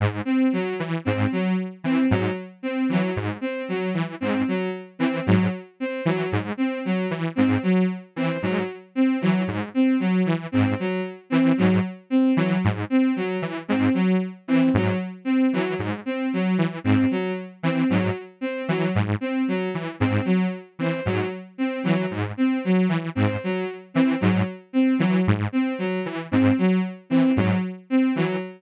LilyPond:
<<
  \new Staff \with { instrumentName = "Lead 2 (sawtooth)" } { \clef bass \time 3/4 \tempo 4 = 114 aes,8 r4 e8 aes,8 r8 | r8 e8 aes,8 r4 e8 | aes,8 r4 e8 aes,8 r8 | r8 e8 aes,8 r4 e8 |
aes,8 r4 e8 aes,8 r8 | r8 e8 aes,8 r4 e8 | aes,8 r4 e8 aes,8 r8 | r8 e8 aes,8 r4 e8 |
aes,8 r4 e8 aes,8 r8 | r8 e8 aes,8 r4 e8 | aes,8 r4 e8 aes,8 r8 | r8 e8 aes,8 r4 e8 |
aes,8 r4 e8 aes,8 r8 | r8 e8 aes,8 r4 e8 | aes,8 r4 e8 aes,8 r8 | r8 e8 aes,8 r4 e8 |
aes,8 r4 e8 aes,8 r8 | r8 e8 aes,8 r4 e8 | }
  \new Staff \with { instrumentName = "Violin" } { \time 3/4 r8 c'8 ges8 r8 c'8 ges8 | r8 c'8 ges8 r8 c'8 ges8 | r8 c'8 ges8 r8 c'8 ges8 | r8 c'8 ges8 r8 c'8 ges8 |
r8 c'8 ges8 r8 c'8 ges8 | r8 c'8 ges8 r8 c'8 ges8 | r8 c'8 ges8 r8 c'8 ges8 | r8 c'8 ges8 r8 c'8 ges8 |
r8 c'8 ges8 r8 c'8 ges8 | r8 c'8 ges8 r8 c'8 ges8 | r8 c'8 ges8 r8 c'8 ges8 | r8 c'8 ges8 r8 c'8 ges8 |
r8 c'8 ges8 r8 c'8 ges8 | r8 c'8 ges8 r8 c'8 ges8 | r8 c'8 ges8 r8 c'8 ges8 | r8 c'8 ges8 r8 c'8 ges8 |
r8 c'8 ges8 r8 c'8 ges8 | r8 c'8 ges8 r8 c'8 ges8 | }
>>